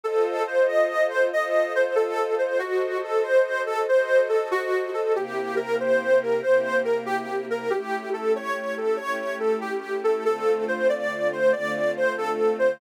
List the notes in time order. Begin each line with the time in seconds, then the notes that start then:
0.03 F4 A4 C5 D#5
0.47 C5
0.68 D#5
1.09 C5
1.31 F4 A4 C5 D#5
1.75 C5
1.95 A4
2.38 C5
2.59 F#4 A4 C5 D#5
3.04 A4
3.23 C5
3.66 A4
3.88 F#4 A4 C5 D#5
4.29 A4
4.51 F#4
4.94 A4
5.15 C3 A#3 E4 G4
5.56 A#4
5.80 C5
6.22 A#4
6.43 C3 A#3 E4 G4 C5
6.84 A#4
7.06 G4
7.50 A#4
7.70 A3 C#4 E4 G4
8.13 A4
8.36 C#5
8.77 A4
8.97 A3 C#4 E4 G4 C#5
9.40 A4
9.61 G4
10.04 A4
10.25 D3 A3 C4 F4 A4
10.68 C5
10.89 D5
11.33 C5
11.52 D3 A3 C4 F4 D5
11.96 C5
12.18 A4
12.59 C5